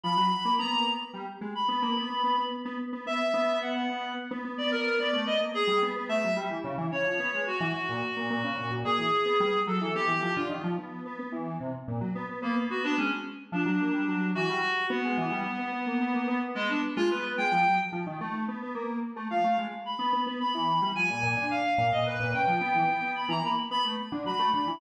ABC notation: X:1
M:9/8
L:1/16
Q:3/8=73
K:none
V:1 name="Clarinet"
b4 _b2 z5 =b b6 | z4 e4 _g4 z3 d _B2 | d2 _e z _A2 z2 =e2 z4 _d4 | _G10 _A6 =A2 |
G3 F z14 | _B, z _G D _D z3 =D6 G4 | B,12 _A, D z F B z | g3 z11 f2 z2 |
b3 z b4 _a4 f3 _e B2 | g6 b _b =b z b z3 b2 b2 |]
V:2 name="Lead 1 (square)"
F, _G, z _B, =B, _B, =B, z =G, z _A, z B, _B, =B, B, B, B, | z B, z B, B, z B,4 B,2 z B, B, B, B, B, | B, A, B, _B, z G, =B, B, A, _G, =G, E, _D, E, D, F, B, _A, | z E, z _B,, z B,, B,, _D, B,, B,, B,, E, z =B, G, z _G, E, |
B, E, F, D, _E, F, B,2 B, B, =E,2 C, z _B,, _G, =B, B, | B, B, B, B, _A, z3 F, _G, _B, =G, _G,2 E, =G, z2 | B, _A, E, G, B, B, B, _B, =B, _B, =B, z B,2 z A, B,2 | _A, F, _G, z F, _E, =A,2 B, B, _B,2 z A, F, A, _A, z |
z B, B, B, B, E,2 G, F, _B,, B,, D,2 z B,, B,, B,, B,, | _D, F, B, E, B, B,2 E, _B, z =B, A, z =D, _G, A, D, E, |]